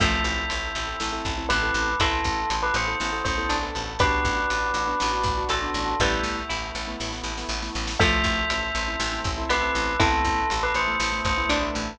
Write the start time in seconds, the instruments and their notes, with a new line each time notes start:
0.00 electric bass (finger) A1, pizzicato strings F3 A3, acoustic grand piano C4 E4 A4, brass section C4 E4 A4, tubular bells E5, kick, crash
0.24 electric bass (finger) A1, closed hi-hat
0.50 electric bass (finger) A1, closed hi-hat
0.75 electric bass (finger) A1, closed hi-hat
0.87 acoustic grand piano C4 E4 A4
1.00 electric bass (finger) A1, brass section A3 C4 A4, acoustic grand piano C4 E4 A4, snare
1.12 acoustic grand piano C4 E4 A4
1.25 electric bass (finger) A1, kick, closed hi-hat
1.38 acoustic grand piano C4 E4 A4
1.49 electric bass (finger) A1, pizzicato strings B3, tubular bells B4, closed hi-hat
1.62 acoustic grand piano C4 E4 A4
1.74 electric bass (finger) A1, closed hi-hat
2.00 electric bass (finger) A1, acoustic grand piano B3 E4 A4, brass section B3 E4 A4, pizzicato strings C4 E4, tubular bells A4, kick, closed hi-hat
2.24 electric bass (finger) A1, kick, closed hi-hat
2.50 electric bass (finger) A1, closed hi-hat
2.62 tubular bells B4
2.74 electric bass (finger) A1, tubular bells C5, closed hi-hat
2.88 acoustic grand piano B3 E4 A4
3.00 electric bass (finger) A1, brass section A3 B3 A4, acoustic grand piano B3 E4 A4, snare
3.12 acoustic grand piano B3 E4 A4
3.24 electric bass (finger) A1, tubular bells C5, kick, closed hi-hat
3.38 acoustic grand piano B3 E4 A4
3.49 electric bass (finger) A1, pizzicato strings D4, closed hi-hat
3.62 acoustic grand piano B3 E4 A4
3.75 electric bass (finger) A1, closed hi-hat
3.99 electric bass (finger) A1, brass section B3 D4 F#4, acoustic grand piano B3 D4 F#4, pizzicato strings G4 B4, tubular bells B4, kick, closed hi-hat
4.25 electric bass (finger) A1, kick, closed hi-hat
4.50 electric bass (finger) A1, closed hi-hat
4.74 electric bass (finger) A1, closed hi-hat
4.88 acoustic grand piano B3 D4 F#4
5.00 electric bass (finger) A1, acoustic grand piano B3 D4 F#4, snare
5.12 acoustic grand piano B3 D4 F#4
5.23 electric bass (finger) A1, kick, closed hi-hat
5.38 acoustic grand piano B3 D4 F#4
5.49 electric bass (finger) A1, tubular bells A4, pizzicato strings A4, closed hi-hat
5.62 acoustic grand piano B3 D4 F#4
5.74 electric bass (finger) A1, closed hi-hat
6.00 electric bass (finger) A1, pizzicato strings G3 B3, acoustic grand piano A3 B3 E4, brass section A3 B3 E4, tubular bells E5, kick, snare
6.23 electric bass (finger) A1, snare
6.49 electric bass (finger) A1, pizzicato strings E4, snare
6.75 electric bass (finger) A1, snare
6.87 acoustic grand piano A3 B3 E4
7.00 electric bass (finger) A1, acoustic grand piano A3 B3 E4, snare
7.12 acoustic grand piano A3 B3 E4, snare
7.23 electric bass (finger) A1, snare
7.38 acoustic grand piano A3 B3 E4, snare
7.49 electric bass (finger) A1, snare
7.62 acoustic grand piano A3 B3 E4, snare
7.75 electric bass (finger) A1, snare
7.87 snare
7.99 electric bass (finger) A1, pizzicato strings F3 A3, acoustic grand piano A3 C4 E4, brass section A4 C5 E5, tubular bells E5, kick, crash
8.24 electric bass (finger) A1, kick, closed hi-hat
8.50 electric bass (finger) A1, closed hi-hat
8.75 electric bass (finger) A1, closed hi-hat
8.87 acoustic grand piano A3 C4 E4
9.00 electric bass (finger) A1, acoustic grand piano A3 C4 E4, snare
9.12 acoustic grand piano A3 C4 E4
9.24 electric bass (finger) A1, kick, closed hi-hat
9.37 acoustic grand piano A3 C4 E4
9.49 electric bass (finger) A1, pizzicato strings B3, tubular bells B4, closed hi-hat
9.63 acoustic grand piano A3 C4 E4
9.75 electric bass (finger) A1, closed hi-hat
9.99 electric bass (finger) A1, acoustic grand piano A3 B3 E4, pizzicato strings C4 E4, brass section A4 B4 E5, tubular bells A4, kick, closed hi-hat
10.24 electric bass (finger) A1, kick, closed hi-hat
10.50 electric bass (finger) A1, closed hi-hat
10.63 tubular bells B4
10.74 electric bass (finger) A1, tubular bells C5, closed hi-hat
10.88 acoustic grand piano A3 B3 E4
11.00 electric bass (finger) A1, acoustic grand piano A3 B3 E4, snare
11.12 acoustic grand piano A3 B3 E4
11.25 electric bass (finger) A1, tubular bells C5, kick, closed hi-hat
11.38 acoustic grand piano A3 B3 E4
11.49 electric bass (finger) A1, pizzicato strings D4, closed hi-hat
11.62 acoustic grand piano A3 B3 E4
11.75 electric bass (finger) A1, closed hi-hat